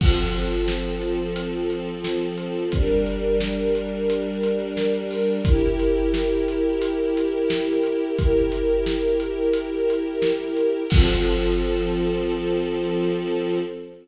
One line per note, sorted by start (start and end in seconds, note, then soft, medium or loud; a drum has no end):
0.00 2.67 F3 medium
0.00 2.67 C4 medium
0.00 2.67 A4 medium
0.00 kick loud
0.00 crash loud
0.35 closed hi-hat medium
0.68 snare medium
1.02 closed hi-hat medium
1.36 closed hi-hat medium
1.70 closed hi-hat medium
2.04 snare medium
2.38 closed hi-hat medium
2.72 5.40 G3 medium
2.72 5.40 D4 medium
2.72 5.40 A#4 medium
2.72 kick medium
2.72 closed hi-hat medium
3.06 closed hi-hat medium
3.41 snare medium
3.75 closed hi-hat medium
4.10 closed hi-hat medium
4.43 closed hi-hat medium
4.77 snare medium
5.11 open hi-hat medium
5.45 8.13 E4 medium
5.45 8.13 G4 medium
5.45 8.13 A#4 medium
5.45 kick loud
5.45 closed hi-hat loud
5.79 closed hi-hat medium
6.14 snare medium
6.48 closed hi-hat medium
6.82 closed hi-hat medium
7.17 closed hi-hat medium
7.50 snare loud
7.83 closed hi-hat medium
8.17 10.84 E4 medium
8.17 10.84 G4 medium
8.17 10.84 A#4 medium
8.17 kick medium
8.17 closed hi-hat medium
8.52 closed hi-hat medium
8.86 snare medium
9.20 closed hi-hat medium
9.54 closed hi-hat medium
9.90 closed hi-hat medium
10.22 snare medium
10.57 closed hi-hat medium
10.90 13.59 F3 loud
10.90 13.59 C4 medium
10.90 13.59 A4 loud
10.90 kick loud
10.90 crash loud